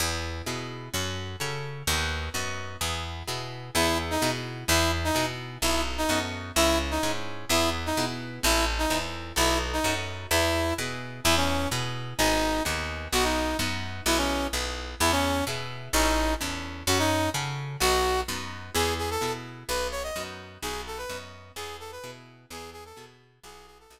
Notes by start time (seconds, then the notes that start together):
0.00 E2 B3 E4 G#4
0.46 B2 B3 E4 G#4
0.94 F#2 C#4 F#4 A4
1.40 C#3 C#4 F#4 A4
1.87 D#2 B3 D#4 F#4
2.34 F#2 B3 D#4 F#4
2.81 E2 B3 E4 G#4
3.28 B2 B3 E4 G#4
3.75 E2 B3 E4 G#4
4.11 D#4
4.22 B2 B3 E4 G#4
4.68 E2 B3 E4 G#4
5.04 D#4
5.15 B2 B3 E4 G#4
5.62 B1 B3 D#4 E4 F#4 A4
5.98 D#4
6.09 F#2 B3 D#4 F#4 A4
6.56 C#2 C#4 E4 G#4
6.91 D#4
7.03 G#2 C#4 E4 G#4
7.49 E2 B3 E4 G#4
7.86 D#4
7.97 B2 B3 E4 G#4
8.43 A1 C4 E4 A4
8.79 D#4
8.90 E2 C4 E4 A4
9.36 B1 B3 D#4 E4 F#4 A4
9.73 D#4
9.84 F#2 B3 D#4 F#4 A4
10.31 E2 B3 E4 G#4
10.78 B2 B3 E4 G#4
11.24 E2 B3 E4 G#4
11.37 C#4
11.71 B2 B3 E4 G#4
12.18 G#1 B3 D#4 G#4
12.65 D#2 B3 D#4 G#4
13.12 B1 B3 D#4 F#4
13.24 D#4
13.59 F#2 B3 D#4 F#4
14.06 B1 B3 E4 G#4
14.17 C#4
14.53 B1 B3 E4 G#4
15.00 E2 B3 E4 G#4
15.12 C#4
15.47 B2 B3 E4 G#4
15.93 A1 C#4 D#4 E4 A4
16.41 E2 C#4 E4 A4
16.87 F#2 C#4 F#4 A4
16.99 D#4
17.34 C#3 C#4 F#4 A4
17.80 B1 B3 D#4 F#4
18.28 F#2 B3 D#4 F#4
18.75 E2 B3 E4 G#4
18.99 G#4
19.11 A4
19.21 B2 B3 E4 G#4
19.69 B1 B3 D#4 F#4 B4
19.92 C#5
20.03 D#5
20.16 F#2 B3 D#4 F#4
20.62 B1 B3 D#4 F#4 G#4
20.87 A4
20.98 B4
21.09 F#2 B3 D#4 F#4
21.56 E2 B3 E4 G#4
21.80 A4
21.92 B4
22.04 B2 B3 E4 G#4
22.50 E2 B3 E4 G#4
22.73 G#4
22.85 A4
22.96 B2 B3 E4 G#4
23.43 B1 B3 E4 F#4 G#4
23.67 G#4
23.80 A4
23.90 B1 B3 D#4 F#4